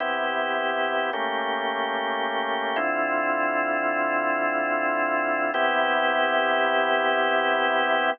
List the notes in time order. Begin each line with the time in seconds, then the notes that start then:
0.00 C3 B3 E4 G4
1.13 A3 A#3 C#4 G4
2.76 D3 C4 E4 F4
5.54 C3 B3 E4 G4